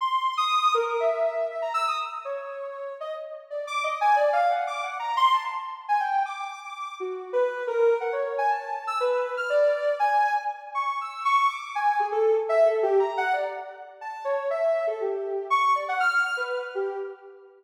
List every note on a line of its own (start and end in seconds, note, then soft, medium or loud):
0.01 0.34 C6 medium
0.37 0.71 D#6 loud
0.74 0.97 A#4 loud
1.00 1.45 E5 medium
1.51 1.62 E5 medium
1.62 1.73 A#5 medium
1.74 1.85 E6 loud
1.87 1.99 D#6 medium
2.25 2.92 C#5 medium
3.00 3.12 D#5 medium
3.50 3.65 D5 medium
3.67 3.82 D6 loud
3.84 3.99 D#5 medium
4.01 4.16 G#5 loud
4.16 4.31 D5 medium
4.33 4.48 F5 loud
4.51 4.66 F#5 medium
4.67 4.82 D6 medium
4.83 4.98 F#5 medium
4.99 5.14 A#5 medium
5.17 5.32 C6 loud
5.33 5.48 A5 medium
5.88 6.00 G#5 medium
6.00 6.22 G5 medium
6.26 6.93 D6 medium
7.00 7.30 F#4 medium
7.33 7.63 B4 loud
7.67 7.97 A#4 loud
8.00 8.12 F#5 medium
8.12 8.35 C#5 medium
8.38 8.49 G#5 medium
8.50 8.84 A5 medium
8.87 8.99 E6 medium
9.00 9.34 B4 medium
9.37 9.48 F6 medium
9.50 9.95 D5 loud
9.99 10.33 G#5 loud
10.75 10.97 C#6 medium
11.01 11.24 E6 medium
11.25 11.47 C#6 loud
11.49 11.72 D6 medium
11.75 11.98 G#5 medium
12.00 12.11 G#4 medium
12.12 12.34 A4 loud
12.49 12.64 E5 loud
12.66 12.81 A4 medium
12.83 12.98 G4 loud
13.00 13.15 A#5 medium
13.17 13.32 F#5 loud
13.33 13.48 D5 medium
14.01 14.24 A5 medium
14.25 14.47 C#5 medium
14.50 14.84 E5 medium
14.87 14.98 A4 medium
15.01 15.46 G4 soft
15.50 15.73 C#6 loud
15.75 15.87 D5 soft
15.88 16.00 F#5 loud
16.00 16.34 F6 loud
16.37 16.71 B4 medium
16.75 16.97 G4 medium